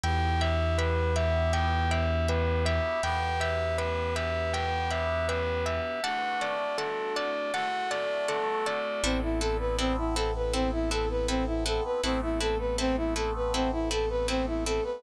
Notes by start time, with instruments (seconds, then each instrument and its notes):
0.03 synth bass 2 E2, brass section B3 E4 G4, pizzicato strings E5 G5 B5, tubular bells G5
0.41 pizzicato strings E5 G5 B5, tubular bells E5
0.78 tubular bells B4, pizzicato strings E5 G5 B5
1.16 pizzicato strings E5 G5 B5, tubular bells E5
1.53 pizzicato strings E5 G5 B5, tubular bells G5
1.91 tubular bells E5, pizzicato strings E5 G5 B5
2.28 tubular bells B4, pizzicato strings E5 G5 B5
2.65 tubular bells E5, pizzicato strings E5 G5 B5
3.03 synth bass 2 E2, brass section B3 G4 B4, pizzicato strings E5 G5 B5, tubular bells G5
3.40 tubular bells E5, pizzicato strings E5 G5 B5
3.78 tubular bells B4, pizzicato strings E5 G5 B5
4.16 tubular bells E5, pizzicato strings E5 G5 B5
4.53 pizzicato strings E5 G5 B5, tubular bells G5
4.90 pizzicato strings E5 G5 B5, tubular bells E5
5.28 tubular bells B4, pizzicato strings E5 G5 B5
5.66 tubular bells E5, pizzicato strings E5 G5 B5
6.03 brass section A3 D4 F#4, pizzicato strings D5 F#5 A5, tubular bells F#5
6.41 pizzicato strings D5 F#5 A5, tubular bells D5
6.78 tubular bells A4, pizzicato strings D5 F#5 A5
7.16 tubular bells D5, pizzicato strings D5 F#5 A5
7.53 brass section A3 F#4 A4, pizzicato strings D5 F#5 A5, tubular bells F#5
7.91 tubular bells D5, pizzicato strings D5 F#5 A5
8.28 tubular bells A4, pizzicato strings D5 F#5 A5
8.66 pizzicato strings D5 F#5 A5, tubular bells D5
9.03 synth bass 2 A1, brass section B3 C4 E4 A4, pizzicato strings C4 E4 A4 B4
9.23 brass section E4
9.40 pizzicato strings C4 E4 A4 B4, brass section A4
9.59 brass section B4
9.78 pizzicato strings C4 E4 A4 B4, brass section C4
9.98 brass section E4
10.16 pizzicato strings C4 E4 A4 B4, brass section A4
10.36 brass section B4
10.53 pizzicato strings C4 E4 A4 B4, brass section C4
10.72 brass section E4
10.91 pizzicato strings C4 E4 A4 B4, brass section A4
11.10 brass section B4
11.28 brass section C4, pizzicato strings C4 E4 A4 B4
11.47 brass section E4
11.66 pizzicato strings C4 E4 A4 B4, brass section A4
11.85 brass section B4
12.03 synth bass 2 A1, brass section A3 B3 C4 A4, pizzicato strings C4 E4 A4 B4
12.22 brass section E4
12.40 pizzicato strings C4 E4 A4 B4, brass section A4
12.59 brass section B4
12.78 pizzicato strings C4 E4 A4 B4, brass section C4
12.97 brass section E4
13.16 pizzicato strings C4 E4 A4 B4, brass section A4
13.36 brass section B4
13.54 brass section C4, pizzicato strings C4 E4 A4 B4
13.72 brass section E4
13.91 pizzicato strings C4 E4 A4 B4, brass section A4
14.10 brass section B4
14.28 pizzicato strings C4 E4 A4 B4, brass section C4
14.47 brass section E4
14.66 pizzicato strings C4 E4 A4 B4, brass section A4
14.84 brass section B4